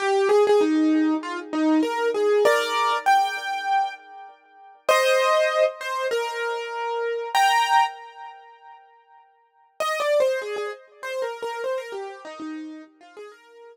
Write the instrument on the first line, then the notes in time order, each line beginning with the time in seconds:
acoustic grand piano
0.00 G4
0.29 G#4
0.47 G#4
0.61 D#4
1.23 F4
1.53 D#4
1.83 A#4
2.14 G#4
2.45 A#4 D5
3.06 G5
4.89 C5 D#5
5.81 C5
6.11 A#4
7.35 G5 A#5
9.80 D#5
10.00 D5
10.20 C5
10.42 G#4
10.56 G#4
11.03 C5
11.22 A#4
11.42 A#4
11.64 C5
11.78 A#4
11.92 G4
12.25 D#4
12.40 D#4
13.01 F4
13.17 G#4
13.32 A#4